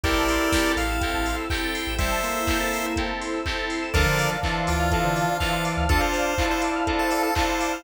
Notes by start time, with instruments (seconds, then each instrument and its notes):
0.04 synth bass 2 A1, pad 5 (bowed) C4 E4 G4 A4, electric piano 2 C4 E4 G4 A4, drawbar organ E4 G4, lead 1 (square) A#4 D5 G5, kick, closed hi-hat
0.16 synth bass 2 A1, lead 1 (square) A5
0.28 lead 1 (square) C6, open hi-hat
0.40 lead 1 (square) E6
0.52 electric piano 2 C4 E4 G4 A4, lead 1 (square) G6, kick, snare
0.65 lead 1 (square) A6
0.77 synth bass 2 A1, lead 1 (square) F5 C7, open hi-hat
0.89 lead 1 (square) E7
1.01 electric piano 2 C4 E4 G4 A4, lead 1 (square) G5, kick, closed hi-hat
1.14 synth bass 2 A1, lead 1 (square) A5
1.26 lead 1 (square) C6, open hi-hat
1.38 lead 1 (square) E6
1.50 electric piano 2 C4 E4 G4 A4, lead 1 (square) G5 G6, kick, clap
1.63 lead 1 (square) A6
1.74 lead 1 (square) C7, open hi-hat
1.87 synth bass 2 A1, lead 1 (square) E7
1.99 drawbar organ G3, electric piano 2 C4 E4 G4 A4, pad 5 (bowed) C4 E4 A4 C5, lead 1 (square) C5 E5 G5, kick, closed hi-hat
2.11 lead 1 (square) A5
2.23 drawbar organ A#3, lead 1 (square) C6, open hi-hat
2.36 lead 1 (square) E6
2.47 electric piano 2 C4 E4 G4 A4, lead 1 (square) G6, kick, clap
2.60 lead 1 (square) A6
2.72 lead 1 (square) C7, open hi-hat
2.84 lead 1 (square) E7
2.96 electric piano 2 C4 E4 G4 A4, lead 1 (square) G5, kick, closed hi-hat
3.09 lead 1 (square) A5
3.21 lead 1 (square) C6, open hi-hat
3.33 lead 1 (square) E6
3.46 electric piano 2 C4 E4 G4 A4, lead 1 (square) G6, kick, clap
3.58 lead 1 (square) A6
3.70 lead 1 (square) C7, open hi-hat
3.82 lead 1 (square) E7
3.94 synth bass 2 D2, drawbar organ D3 F3, electric piano 2 C4 D4 F4 A4, lead 1 (square) A4 A#4 D5, pad 5 (bowed) C5 D5 F5 A5, kick, closed hi-hat
4.06 synth bass 2 D3, lead 1 (square) C5
4.19 lead 1 (square) D5, open hi-hat
4.31 lead 1 (square) F5
4.43 drawbar organ E3, electric piano 2 C4 D4 F4 A4, lead 1 (square) A5, kick, clap
4.56 lead 1 (square) C6
4.67 synth bass 2 D2, lead 1 (square) F4 D6, open hi-hat
4.79 lead 1 (square) F6
4.91 electric piano 2 C4 D4 F4 A4, lead 1 (square) A4, kick, closed hi-hat
5.04 synth bass 2 D3, lead 1 (square) C5
5.16 lead 1 (square) D5, open hi-hat
5.28 lead 1 (square) F5
5.40 drawbar organ E3, electric piano 2 C4 D4 F4 A4, lead 1 (square) F5 A5, kick, clap
5.53 lead 1 (square) C6
5.65 lead 1 (square) D6, open hi-hat
5.77 synth bass 2 D2, lead 1 (square) F6
5.89 electric piano 2 C4 D4 F4 A4, drawbar organ D4 F4, lead 1 (square) A4, kick, closed hi-hat
6.01 lead 1 (square) C5
6.14 lead 1 (square) D5, open hi-hat
6.26 lead 1 (square) F5
6.38 electric piano 2 C4 D4 F4 A4, drawbar organ E4, lead 1 (square) A5, kick, clap
6.50 lead 1 (square) C5 C6
6.62 lead 1 (square) D6, open hi-hat
6.75 lead 1 (square) F6
6.86 electric piano 2 C4 D4 F4 A4, lead 1 (square) A4, kick, closed hi-hat
6.99 lead 1 (square) A4 C5
7.11 lead 1 (square) A4 D5, open hi-hat
7.23 lead 1 (square) A4 F5
7.35 electric piano 2 C4 D4 F4 A4, drawbar organ E4, lead 1 (square) C5 A5, kick, clap
7.48 lead 1 (square) C6
7.60 lead 1 (square) D6, open hi-hat
7.72 lead 1 (square) F6